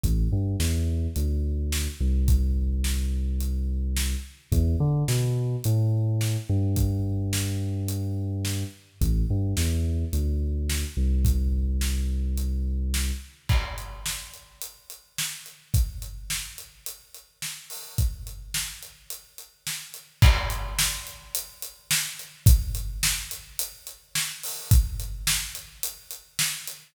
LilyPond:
<<
  \new Staff \with { instrumentName = "Synth Bass 2" } { \clef bass \time 4/4 \key e \minor \tempo 4 = 107 a,,8 g,8 e,4 d,4. c,8~ | c,1 | e,8 d8 b,4 a,4. g,8~ | g,1 |
a,,8 g,8 e,4 d,4. c,8~ | c,1 | \key a \minor r1 | r1 |
r1 | r1 | r1 | r1 | }
  \new DrumStaff \with { instrumentName = "Drums" } \drummode { \time 4/4 <hh bd>4 sn4 hh4 sn4 | <hh bd>4 sn4 hh4 sn4 | <hh bd>4 sn4 hh4 sn4 | <hh bd>4 sn4 hh4 sn4 |
<hh bd>4 sn4 hh4 sn4 | <hh bd>4 sn4 hh4 sn4 | <cymc bd>8 hh8 sn8 hh8 hh8 hh8 sn8 hh8 | <hh bd>8 hh8 sn8 hh8 hh8 hh8 sn8 hho8 |
<hh bd>8 hh8 sn8 hh8 hh8 hh8 sn8 hh8 | <cymc bd>8 hh8 sn8 hh8 hh8 hh8 sn8 hh8 | <hh bd>8 hh8 sn8 hh8 hh8 hh8 sn8 hho8 | <hh bd>8 hh8 sn8 hh8 hh8 hh8 sn8 hh8 | }
>>